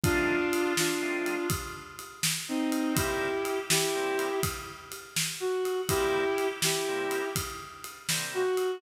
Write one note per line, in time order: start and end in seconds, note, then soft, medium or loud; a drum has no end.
0.03 0.39 F3 medium
0.03 0.39 A3 medium
0.03 0.39 C4 medium
0.03 0.73 D4 loud
0.03 0.39 D#4 medium
0.03 0.73 F4 loud
0.03 kick loud
0.03 ride loud
0.53 ride medium
0.77 1.47 D4 medium
0.77 1.47 F4 medium
0.77 snare loud
1.02 1.36 F3 medium
1.02 1.36 A3 medium
1.02 1.36 C4 medium
1.02 1.36 D#4 medium
1.26 ride medium
1.50 kick loud
1.50 ride loud
1.99 ride medium
2.23 snare loud
2.48 2.94 C4 medium
2.48 2.94 D#4 medium
2.72 ride medium
2.95 3.29 C3 medium
2.95 3.29 G3 medium
2.95 3.29 A#3 medium
2.95 3.29 E4 medium
2.95 3.59 E4 medium
2.95 3.59 G4 medium
2.95 kick loud
2.95 ride loud
3.45 ride medium
3.70 4.40 E4 medium
3.70 4.40 G4 medium
3.70 snare loud
3.95 4.29 C3 medium
3.95 4.29 G3 medium
3.95 4.29 A#3 medium
3.95 4.29 E4 medium
4.19 ride medium
4.43 kick loud
4.43 ride loud
4.92 ride medium
5.16 snare loud
5.40 5.81 F#4 medium
5.65 ride medium
5.89 6.24 C3 medium
5.89 6.24 G3 medium
5.89 6.24 A#3 medium
5.89 6.47 E4 medium
5.89 6.24 E4 medium
5.89 6.47 G4 loud
5.89 kick loud
5.89 ride loud
6.38 ride medium
6.62 7.29 E4 medium
6.62 7.29 G4 medium
6.62 snare loud
6.88 7.22 C3 medium
6.88 7.22 G3 medium
6.88 7.22 A#3 medium
6.88 7.22 E4 medium
7.11 ride medium
7.36 kick medium
7.36 ride loud
7.84 ride medium
8.09 8.43 C3 medium
8.09 8.43 G3 medium
8.09 8.43 A#3 medium
8.09 8.43 E4 medium
8.09 snare loud
8.34 8.77 F#4 loud
8.57 ride medium